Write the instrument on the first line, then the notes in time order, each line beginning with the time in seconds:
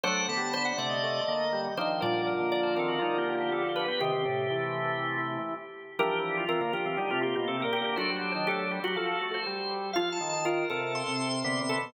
drawbar organ
0.04 F#3 A3 D4 C5 F#5
0.20 A3
0.29 D3 B3 A5
0.37 G3
0.54 D3 C5
0.65 F#5
0.78 C3 A3 D5
0.89 D#5
1.03 A3
1.28 D3 A#3
1.53 G3
1.77 D#3 F3 D4 C5
2.01 A#2 D3 F3 G3 A#4 D5
2.27 A#4
2.39 D3 A#3
2.52 D5
2.63 C5
2.76 D#3 C4 A4 A#4
2.88 F#4
2.99 G3 D#4 F4
3.18 A#3 G4
3.29 G4
3.35 A#3 G4
3.40 G4
3.51 B3 G4 A4
3.69 G4
3.76 B4
3.85 B3 G4 B4
4.00 C3 D#3 C4 G4
4.13 D#3 C4
4.26 A2 C3 A3
4.50 E3
5.99 E3 F3 G3 D4 G4 A#4
6.37 F4
6.49 E3 F3 C4 A#4
6.61 D3 A#3
6.72 F3 D4 F4 G4
6.86 E3 F3 C4
6.97 D3 G3 D#4 G4
7.11 C3 A3 F4
7.21 A#3 F4 G4
7.35 B2 A#3 G4
7.48 C3 A4
7.60 A#3 G4 A#4
7.64 A#2
7.73 A#3 G4
7.81 D3 A#3 G4 A#4
7.96 F#3 A3 D4 F#4 C5
8.10 G3
8.16 C5
8.32 D#3 C5
8.47 A3 G4 A4
8.71 G3 G4
8.84 F#3 F#4
8.96 F3 A4
9.21 A3
9.34 C5
9.46 G3
9.93 F3 F4 F5
10.12 A5
10.20 D#3
10.29 A5
10.45 F4 A#4
10.70 C3 A4 A#4
10.95 C6
11.07 C3
11.44 C3 D3 B3
11.61 C3
11.69 A4
11.78 B2